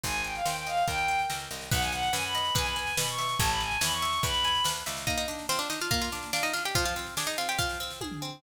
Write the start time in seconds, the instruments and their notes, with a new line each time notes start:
0.03 electric bass (finger) G#1, orchestral harp C5, violin G#5, kick, snare
0.14 snare
0.24 violin G5, orchestral harp G#5, snare
0.35 violin F5, snare
0.45 electric bass (finger) D#2, orchestral harp C5, violin G5, snare
0.56 violin G5, snare
0.66 orchestral harp D#5, violin F5, snare
0.77 snare
0.87 electric bass (finger) D#2, orchestral harp A#4, violin G5, kick, snare
0.98 snare
1.08 orchestral harp G5, snare
1.19 snare
1.30 electric bass (finger) C#2, orchestral harp A#4, snare
1.40 snare
1.51 electric bass (finger) C2, orchestral harp D#5, snare
1.61 snare
1.71 electric bass (finger) B1, orchestral harp B4, violin F#5, kick, snare, crash
1.81 violin G#5, snare
1.92 orchestral harp F#5, violin F#5, snare
2.03 snare
2.13 electric bass (finger) F#2, orchestral harp B4, violin G#5, snare
2.24 violin B5, snare
2.34 orchestral harp D#5, snare
2.45 snare
2.55 electric bass (finger) E2, orchestral harp B4, violin G#5, kick, snare
2.65 violin B5, snare
2.76 orchestral harp G#5, violin G#5, snare
2.87 snare
2.97 electric bass (finger) B2, orchestral harp B4, violin B5, snare
3.08 violin C#6, snare
3.18 orchestral harp E5, snare
3.29 snare
3.39 electric bass (finger) A1, orchestral harp C#5, violin A5, kick, snare
3.50 violin B5, snare
3.60 violin G#5, orchestral harp A5, snare
3.71 snare
3.81 electric bass (finger) E2, orchestral harp C#5, violin B5, snare
3.92 violin C#6, snare
4.02 orchestral harp E5, snare
4.13 snare
4.23 electric bass (finger) E2, orchestral harp B4, violin B5, kick, snare
4.34 snare
4.44 orchestral harp G#5, snare
4.55 snare
4.64 electric bass (finger) D2, orchestral harp B4, snare
4.76 snare
4.86 electric bass (finger) C#2, orchestral harp E5, snare
4.97 snare
5.07 orchestral harp A#3, pizzicato strings D#4 D#5, kick, snare
5.18 pizzicato strings D#4 D#5, snare
5.28 orchestral harp D4, snare
5.39 snare
5.49 pizzicato strings C4 C5, orchestral harp F4, snare
5.59 pizzicato strings D4 D5, snare
5.70 orchestral harp D4, pizzicato strings D#4 D#5, snare
5.81 pizzicato strings F4 F5, snare
5.91 orchestral harp A#3, pizzicato strings F4 F5, kick, snare
6.01 pizzicato strings F4 F5, snare
6.12 orchestral harp D4, snare
6.23 snare
6.33 pizzicato strings D4 D5, orchestral harp F4, snare
6.43 pizzicato strings D#4 D#5, snare
6.53 orchestral harp D4, pizzicato strings F4 F5, snare
6.65 pizzicato strings G4 G5, snare
6.75 orchestral harp F3, pizzicato strings F4 F5, kick, snare
6.85 pizzicato strings F4 F5, snare
6.96 orchestral harp C4, snare
7.06 snare
7.17 pizzicato strings D4 D5, orchestral harp G#4, snare
7.27 pizzicato strings D#4 D#5, snare
7.38 orchestral harp C4, pizzicato strings F4 F5, snare
7.49 pizzicato strings G4 G5, snare
7.58 orchestral harp F3, pizzicato strings F4 F5, kick, snare
7.69 snare
7.80 orchestral harp C4, snare
7.90 snare
8.01 orchestral harp G#4, kick, high tom
8.11 floor tom
8.22 orchestral harp C4